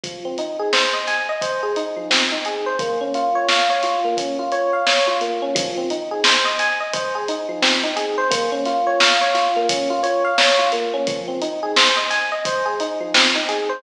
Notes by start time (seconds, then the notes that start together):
0.03 F3, kick, closed hi-hat
0.25 C4
0.38 D#4, closed hi-hat
0.59 G#4
0.73 C5, snare
0.93 D#5
1.07 G#5, snare, closed hi-hat
1.29 D#5
1.41 C5, kick, closed hi-hat
1.63 G#4
1.76 D#4, closed hi-hat
1.96 F3
2.10 C4, snare
2.32 D#4
2.45 G#4, closed hi-hat
2.66 C5
2.79 A#3, kick, closed hi-hat
3.01 C#4
3.14 F4, closed hi-hat
3.35 C#5
3.48 F5, snare
3.70 C#5
3.83 F4, snare, closed hi-hat
4.05 A#3
4.17 C#4, kick, closed hi-hat
4.39 F4
4.52 C#5, closed hi-hat
4.73 F5
4.87 C#5, snare
5.07 F4
5.21 A#3, closed hi-hat
5.42 C#4
5.55 F3, kick, closed hi-hat
5.77 C4
5.90 D#4, closed hi-hat
6.11 G#4
6.24 C5, snare
6.45 D#5
6.59 G#5, snare, closed hi-hat
6.80 D#5
6.93 C5, kick, closed hi-hat
7.15 G#4
7.28 D#4, closed hi-hat
7.49 F3
7.62 C4, snare
7.83 D#4
7.96 G#4, closed hi-hat
8.18 C5
8.30 A#3, kick, closed hi-hat
8.52 C#4
8.65 F4, snare, closed hi-hat
8.87 C#5
9.00 F5, snare
9.21 C#5
9.34 F4, snare, closed hi-hat
9.56 A#3
9.69 C#4, kick, closed hi-hat
9.90 F4
10.03 C#5, closed hi-hat
10.24 F5
10.38 C#5, snare
10.59 F4
10.72 A#3, closed hi-hat
10.94 C#4
11.07 F3, kick, closed hi-hat
11.28 C4
11.42 D#4, closed hi-hat
11.63 G#4
11.76 C5, snare
11.96 D#5
12.10 G#5, snare, closed hi-hat
12.32 D#5
12.45 C5, kick, closed hi-hat
12.66 G#4
12.80 D#4, closed hi-hat
13.00 F3
13.14 C4, snare
13.35 D#4
13.49 G#4, closed hi-hat
13.69 C5